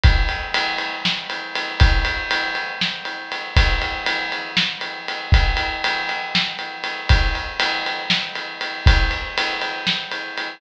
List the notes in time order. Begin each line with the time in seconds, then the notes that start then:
0.03 kick, ride
0.29 ride
0.54 ride
0.78 ride
1.05 snare
1.30 ride
1.55 ride
1.80 kick, ride
2.05 ride
2.31 ride
2.55 ride
2.81 snare
3.05 ride
3.32 ride
3.57 kick, ride
3.82 ride
4.06 ride
4.32 ride
4.57 snare
4.81 ride
5.08 ride
5.32 kick, ride
5.57 ride
5.84 ride
6.09 ride
6.35 snare
6.59 ride
6.84 ride
7.09 kick, ride
7.35 ride
7.60 ride
7.86 ride
8.10 snare
8.35 ride
8.61 ride
8.86 kick, ride
9.11 ride
9.38 ride
9.61 ride
9.87 snare
10.11 ride
10.38 ride